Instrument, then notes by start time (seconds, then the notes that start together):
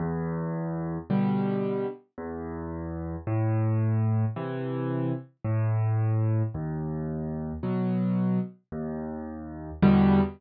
acoustic grand piano
0.00 E2
1.10 B2 D3 G3
2.18 E2
3.27 A2
4.36 C3 E3
5.45 A2
6.54 D#2
7.63 B2 F#3
8.72 D#2
9.82 E2 B2 D3 G3